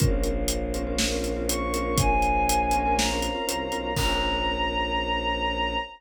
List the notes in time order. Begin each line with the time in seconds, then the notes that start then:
0.00 A#1 C4 C#4 F4 A#4 C5 C#5 F5, kick, closed hi-hat
0.23 closed hi-hat
0.48 closed hi-hat
0.74 C4 C#4 F4 A#4, closed hi-hat
0.87 C4 C#4 F4 A#4
0.98 snare
1.12 C4 C#4 F4 A#4
1.24 closed hi-hat
1.36 C4 C#4 F4 A#4
1.49 C4 C#4 F4 A#4 C#6, closed hi-hat
1.74 C4 C#4 F4 A#4, closed hi-hat
1.98 G#5, kick, closed hi-hat
2.22 closed hi-hat
2.49 closed hi-hat
2.71 C4 C#4 F4 A#4, closed hi-hat
2.85 C4 C#4 F4 A#4
2.97 A#5, snare
3.10 C4 C#4 F4 A#4
3.22 closed hi-hat
3.35 C4 C#4 F4 A#4
3.47 C2 C4 C#4 F4 A#4, closed hi-hat
3.72 B1 C4 C#4 F4 A#4, closed hi-hat
3.96 A#1 A#3 C4 C#4 F4 A#4 A#5, kick, crash